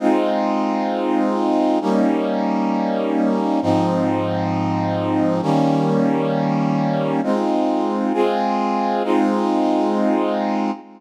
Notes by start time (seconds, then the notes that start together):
0.00 G#3 C4 D#4 F4
1.81 G3 A#3 C#4 D#4
3.62 G#2 F3 C4 D#4
5.42 D#3 G3 A#3 C#4
7.23 G#3 C4 D#4 F4
8.13 G#3 C4 F4 G#4
9.04 G#3 C4 D#4 F4